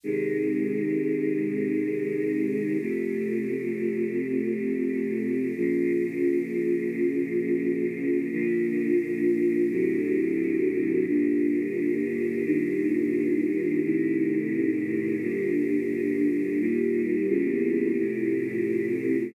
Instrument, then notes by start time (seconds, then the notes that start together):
choir aahs
0.03 C3 D#3 G#3
2.79 F2 C3 A3
5.55 A#2 C#3 F3
8.31 A#2 D3 F3
9.69 D2 A2 C3 F#3
11.07 G2 A#2 D3
12.45 G2 A#2 D#3
13.83 A2 C3 D#3
15.21 G2 A#2 D3
16.58 D#2 A#2 G3
17.28 E2 A#2 C#3 G3
17.97 F2 A2 C3